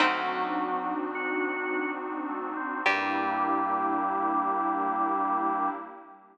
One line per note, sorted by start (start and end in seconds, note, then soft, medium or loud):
0.00 2.63 D2 medium
0.00 0.94 F#3 medium
0.00 1.04 C4 loud
0.00 2.83 C4 medium
0.00 2.57 C4 medium
0.00 2.83 D4 medium
0.00 2.57 D4 loud
0.00 1.04 D#4 loud
0.00 2.83 D#4 medium
0.00 2.57 D#4 loud
0.00 2.83 F#4 medium
0.00 2.57 F#4 loud
1.15 1.91 F#4 medium
2.29 2.54 A3 medium
2.57 2.82 C4 medium
2.86 5.70 G2 loud
2.86 5.70 G3 loud
2.86 5.70 A#3 loud
2.86 5.71 A#3 loud
2.86 5.70 D4 loud
2.86 5.71 D4 loud
2.86 5.70 E4 loud
2.86 5.71 E4 loud
2.86 5.70 G4 loud
2.86 5.70 G4 medium
2.86 5.71 G4 loud